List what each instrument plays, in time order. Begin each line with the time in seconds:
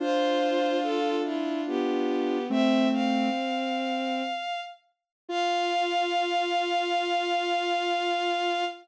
0.00 ocarina D4 F4, violin F4 C5
0.83 violin A4
1.24 violin E4 F4
1.66 violin B3 G4
2.50 ocarina A3 C4, violin C4 E5
2.91 violin C4 F5
5.29 ocarina F4, violin F4 F5